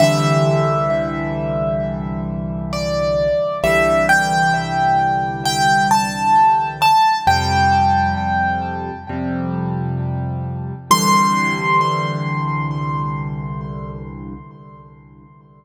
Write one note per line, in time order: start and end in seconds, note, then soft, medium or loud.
0.00 3.27 C2 medium
0.00 3.27 D3 loud
0.00 3.27 E3 loud
0.00 3.27 G3 loud
0.00 2.21 E5 medium
2.73 3.58 D5 medium
3.63 6.91 C2 medium
3.63 6.91 D3 medium
3.63 6.91 E3 medium
3.63 6.91 G3 loud
3.63 4.06 E5 medium
4.09 5.41 G5 medium
5.45 5.88 G5 medium
5.91 6.68 A5 medium
6.82 7.19 A5 medium
7.27 8.91 F2 loud
7.27 8.91 C3 medium
7.27 8.91 G3 medium
7.27 8.73 G5 medium
9.09 10.73 F2 medium
9.09 10.73 C3 medium
9.09 10.73 G3 medium
10.91 14.34 C2 loud
10.91 14.34 D3 loud
10.91 14.34 E3 medium
10.91 14.34 G3 loud
10.91 14.34 C6 loud